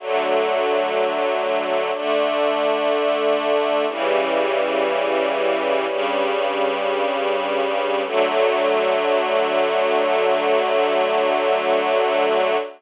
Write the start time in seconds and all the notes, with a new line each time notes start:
0.00 D3 F#3 A3
1.94 D3 A3 D4
3.88 C#3 E3 G3
5.88 G2 C#3 G3
8.05 D3 F#3 A3